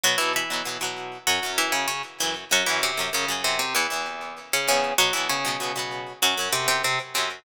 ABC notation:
X:1
M:4/4
L:1/16
Q:1/4=97
K:F#mix
V:1 name="Acoustic Guitar (steel)"
[F,F] [E,E] [E,E]6 [F,F]2 [E,E] [C,C] [C,C] z [E,E] z | [F,F] [E,E] [=C,^B,]2 [^C,C]2 [=C,=C] [C,C] [E,E]4 z [^C,^C] [C,C]2 | [F,F] [E,E] [C,C]6 [F,F]2 [=C,=C] [C,C] [C,C] z [C,C] z |]
V:2 name="Acoustic Guitar (steel)"
[B,,B,] [B,,F,B,]2 [B,,F,B,] [B,,F,B,] [B,,F,B,]3 [F,,C] [F,,F,C]5 [F,,F,C]2 | [F,,C] [F,,F,C]2 [F,,F,C] [F,,F,] [F,,F,C]3 [E,,B,] [E,,E,B,]5 [E,,E,B,]2 | [B,,B,] [B,,F,B,]2 [B,,F,B,] [B,,F,B,] [B,,F,B,]3 [F,,C] [F,,F,C]5 [F,,F,C]2 |]